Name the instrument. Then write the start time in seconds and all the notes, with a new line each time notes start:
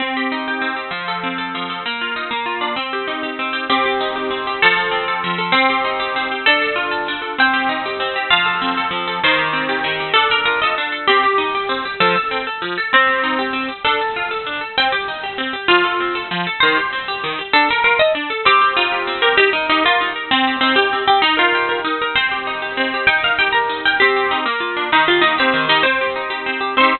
orchestral harp
0.00 C4
0.17 G4
0.32 D#4
0.48 G4
0.62 C4
0.76 G4
0.91 F3
1.08 A4
1.23 C4
1.38 A4
1.55 F3
1.70 A4
1.86 A#3
2.01 F4
2.16 D#4
2.31 A#3
2.46 F4
2.61 D4
2.76 C4
2.93 G4
3.07 D#4
3.23 G4
3.39 C4
3.53 G4
3.70 C4 G4
3.86 G4
4.01 D#4
4.16 G4
4.31 C4
4.47 G4
4.62 F3 A4
4.77 A4
4.91 C4
5.08 A4
5.24 F3
5.38 A4
5.52 C4
5.70 G4
5.84 D#4
6.00 G4
6.16 C4
6.31 G4
6.46 D4 A4
6.62 A4
6.76 F4
6.91 A4
7.08 D4
7.22 A4
7.38 C4 G5
7.53 G4
7.69 D#4
7.86 G4
8.00 C4
8.16 G4
8.30 F3 F4
8.46 A4
8.62 C4
8.77 A4
8.91 F3
9.07 A4
9.24 D#3 C5
9.39 G4
9.53 C4
9.69 G4
9.84 D#3
10.00 G4
10.14 D4 A4
10.30 A4 A#4
10.45 F4 A#4
10.62 A4 D#5
10.78 D4
10.92 A4
11.07 C4 G4
11.23 G4
11.38 D#4
11.55 G4
11.69 C4
11.85 G4
12.00 F3 A4
12.16 A4
12.31 C4
12.47 A4
12.62 F3
12.78 A4
12.94 C4
13.07 G4
13.23 D#4
13.39 G4
13.53 C4
13.69 G4
13.84 D4 A4
14.01 A4
14.16 F4
14.31 A4
14.46 D4
14.61 A4
14.78 C4 G5
14.92 G4
15.08 D#4
15.23 G4
15.38 C4
15.53 G4
15.68 F3 F4
15.84 A4
16.00 C4
16.15 A4
16.31 F3
16.47 A4
16.60 D#3 C5
16.77 G4
16.93 C4
17.08 G4
17.24 D#3
17.39 G4
17.53 D4 A4
17.69 A4 A#4
17.84 F4 A#4
17.99 A4 D#5
18.15 D4
18.30 A4
18.45 C4 G4
18.61 G4
18.77 D#4 F4
18.92 G4
19.07 C4
19.22 G4 A#4
19.37 D#4 G4
19.53 D#4 A#4
19.69 D#4 G4
19.84 F4 A#4
20.01 D#4
20.16 A#4
20.31 C4
20.47 G4
20.61 C4 D#4
20.76 G4
20.93 C4
21.08 G4
21.22 D#4
21.37 F4 A#4
21.55 G4
21.69 A#4
21.84 D#4
22.02 A#4
22.15 C4 C5
22.31 G4
22.47 D#4
22.62 G4
22.77 C4
22.94 G4
23.07 D#4 G5
23.23 A#4 F5
23.39 G4 G5
23.52 A#4 A#5
23.69 D#4
23.85 A#4 G5
24.00 C4 G4
24.16 G4
24.31 D#4
24.46 A#3
24.60 F4
24.77 D4
24.92 D#3 D#4
25.08 F4 G4
25.21 A#3 D#4
25.38 C4 G4
25.54 D#3
25.69 D#4 G4
25.83 C4 C5
26.01 G4
26.16 D#4
26.30 G4
26.46 C4
26.61 G4
26.77 C4 D#4 C5
26.84 G4